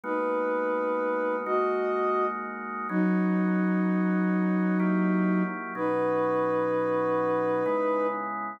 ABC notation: X:1
M:3/4
L:1/8
Q:1/4=63
K:G#m
V:1 name="Ocarina"
[DB]3 [Fd]2 z | [K:B] [F,D]6 | [DB]6 |]
V:2 name="Drawbar Organ"
[G,A,B,F]3 [G,A,DF]3 | [K:B] [B,CDF]4 [F,A,E=G]2 | [B,,F,CD]4 [C,G,B,E]2 |]